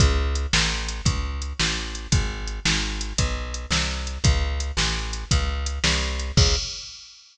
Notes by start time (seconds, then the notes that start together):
0.00 C#2, kick, closed hi-hat
0.35 closed hi-hat
0.53 A1, snare
0.88 closed hi-hat
1.05 C#2, kick, closed hi-hat
1.42 closed hi-hat
1.60 A1, snare
1.95 closed hi-hat
2.12 G#1, kick, closed hi-hat
2.47 closed hi-hat
2.65 G#1, snare
3.01 closed hi-hat
3.18 B1, kick, closed hi-hat
3.54 closed hi-hat
3.71 C2, snare
4.07 closed hi-hat
4.24 C#2, kick, closed hi-hat
4.60 closed hi-hat
4.77 A1, snare
5.13 closed hi-hat
5.31 C#2, kick, closed hi-hat
5.66 closed hi-hat
5.84 C2, snare
6.19 closed hi-hat
6.37 C#2, kick, crash